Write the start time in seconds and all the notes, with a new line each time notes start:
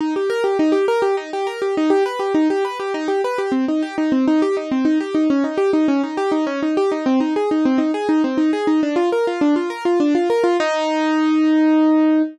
0.00 D#4
0.16 G4
0.30 A#4
0.44 G4
0.59 D#4
0.72 G4
0.88 A#4
1.02 G4
1.17 D#4
1.33 G4
1.47 A#4
1.62 G4
1.77 D#4
1.90 G4
2.06 B4
2.19 G4
2.34 D#4
2.50 G4
2.65 B4
2.80 G4
2.94 D#4
3.08 G4
3.24 B4
3.38 G4
3.52 C4
3.68 D#4
3.82 G4
3.98 D#4
4.12 C4
4.28 D#4
4.42 G4
4.57 D#4
4.71 C4
4.85 D#4
5.00 G4
5.15 D#4
5.30 C#4
5.44 D#4
5.57 G4
5.73 D#4
5.88 C#4
6.03 D#4
6.17 G4
6.32 D#4
6.47 C#4
6.62 D#4
6.77 G4
6.92 D#4
7.06 C4
7.20 D#4
7.36 G#4
7.51 D#4
7.65 C4
7.78 D#4
7.94 G#4
8.09 D#4
8.24 C4
8.37 D#4
8.53 G#4
8.67 D#4
8.83 D4
8.96 F4
9.12 A#4
9.27 F4
9.41 D4
9.56 F4
9.70 A#4
9.85 F4
10.00 D4
10.15 F4
10.30 A#4
10.44 F4
10.60 D#4